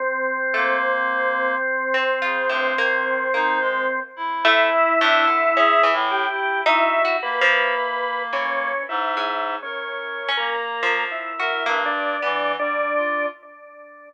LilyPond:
<<
  \new Staff \with { instrumentName = "Drawbar Organ" } { \time 6/4 \tempo 4 = 54 c'1 e'4. g'8 | e'8 b'4 cis'8 \tuplet 3/2 { e'4 cis'4 ais'4 e'4 d'4 d'4 } | }
  \new Staff \with { instrumentName = "Clarinet" } { \time 6/4 r8 ais4 r8 cis16 g,16 dis8 dis'16 gis16 r16 e'8. d'16 r16 \tuplet 3/2 { gis'8 a,8 e'8 } | fis'8 ais4. \tuplet 3/2 { gis,4 ais'4 ais4 } r16 ais'16 g,8 \tuplet 3/2 { e8 g8 f'8 } | }
  \new Staff \with { instrumentName = "Orchestral Harp" } { \time 6/4 r8 a16 r4 c'16 f'16 a,16 ais8 ais8. r16 a16 r16 a,16 d16 cis'16 e16 r8 | \tuplet 3/2 { dis'8 fis'8 f8 } r8 e8. gis8 r8 cis'16 r16 f8 fis'16 ais16 r16 b4 | }
>>